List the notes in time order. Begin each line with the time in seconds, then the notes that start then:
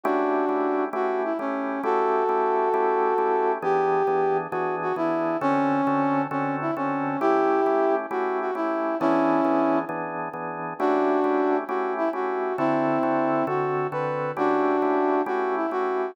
0.04 A3 C#4 D4 E4 F#4 G4
0.49 A3 C#4 E4 G4
0.93 A3 C#4 E4 F#4 G4
1.24 E4
1.39 A3 C#4 E4 G4
1.83 A3 C#4 E4 F#4 G4 A4
2.29 A3 C#4 E4 G4
2.74 A3 C#4 E4 G4
3.18 A3 C#4 E4 G4
3.62 E3 B3 D4 G4 G#4
4.07 E3 B3 D4 G#4
4.51 E3 B3 D4 F#4 G#4
4.82 F#4
4.96 E3 B3 D4 E4 G#4
5.41 D3 C4 C#4 F#4 A4
5.87 D3 C4 F#4 A4
6.31 D3 C4 C#4 F#4 A4
6.61 E4
6.77 D3 C4 C#4 F#4 A4
7.20 A3 C#4 E4 G4
7.66 A3 C#4 E4 G4
8.11 A3 C#4 E4 F#4 G4
8.41 F#4
8.55 A3 C#4 E4 G4
9.00 E3 B3 C#4 D4 E4 G#4
9.45 E3 B3 D4 G#4
9.89 E3 B3 D4 G#4
10.34 E3 B3 D4 G#4
10.79 A3 C#4 D4 E4 F#4 G4
11.24 A3 C#4 E4 G4
11.68 A3 C#4 E4 F#4 G4
11.98 E4
12.13 A3 C#4 E4 F#4 G4
12.58 D3 C4 E4 F#4 A4
13.03 D3 C4 F#4 A4
13.47 D3 C4 F#4 A4
13.92 D3 C4 F#4 A4 B4
14.37 A3 C#4 D4 E4 F#4 G4
14.82 A3 C#4 E4 G4
15.26 A3 C#4 E4 F#4 G4
15.56 E4
15.71 A3 C#4 E4 F#4 G4